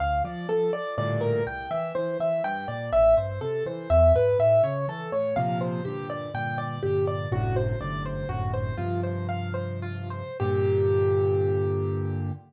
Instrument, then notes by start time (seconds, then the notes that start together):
acoustic grand piano
0.00 D2 F5
0.24 F3 D5
0.49 F3 A4
0.73 F3 D5
0.98 G2 A2 A#2 D3 D5
1.21 A#4
1.46 C2 G5
1.71 E3 E5
1.95 E3 C5
2.20 E3 E5
2.44 G2 G5
2.68 A#2 D5
2.93 A1 E5
3.17 G2 C5
3.41 C3 A4
3.66 E3 C5
3.90 E2 E5
4.15 G#2 B4
4.39 A2 E5
4.63 C#3 C#5
4.88 E3 A4
5.12 A2 C#5
5.36 A#2 C3 F3 F5
5.61 C5
5.85 G2 A#2 D3 G4
6.10 D5
6.34 G2 A#2 D3 G5
6.58 D5
6.83 G2 A#2 D3 G4
7.07 D5
7.32 G1 F#2 A2 C3 D3 F#4
7.56 C5
7.81 G1 F#2 A2 C3 D3 D5
8.06 C5
8.29 G1 F#2 A2 C3 D3 F#4
8.54 C5
8.77 G2 C3 F3 F4
9.03 C5
9.29 F5
9.54 C5
9.82 F4
10.10 C5
10.40 G2 A#2 D3 G4